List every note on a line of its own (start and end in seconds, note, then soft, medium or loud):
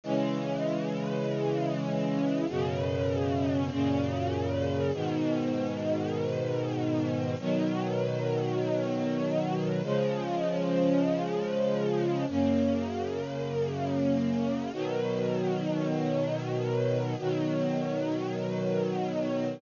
0.03 2.46 C#3 medium
0.03 2.46 E3 medium
0.03 2.46 G#3 medium
2.48 3.70 F#2 loud
2.48 3.70 B2 medium
2.48 3.70 C#3 loud
3.70 4.91 F#2 medium
3.70 4.91 A#2 medium
3.70 4.91 C#3 loud
4.93 7.35 G#2 loud
4.93 7.35 B2 medium
4.93 7.35 D#3 medium
7.39 9.82 B2 medium
7.39 9.82 D#3 loud
7.39 9.82 F#3 loud
9.83 12.25 C#3 loud
9.83 12.25 F3 loud
9.83 12.25 G#3 medium
12.28 14.71 F#2 medium
12.28 14.71 C#3 medium
12.28 14.71 A#3 medium
14.73 17.15 B2 loud
14.73 17.15 D#3 medium
14.73 17.15 F#3 medium
17.18 19.61 B2 medium
17.18 19.61 D#3 medium
17.18 19.61 F#3 loud